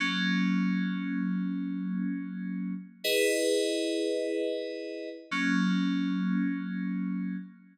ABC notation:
X:1
M:4/4
L:1/8
Q:1/4=158
K:F#mix
V:1 name="Electric Piano 2"
[F,A,C]8- | [F,A,C]8 | [M:2/4] [EGBd]4- | [M:4/4] [EGBd]8 |
[F,A,C]8- | [M:2/4] [F,A,C]4 |]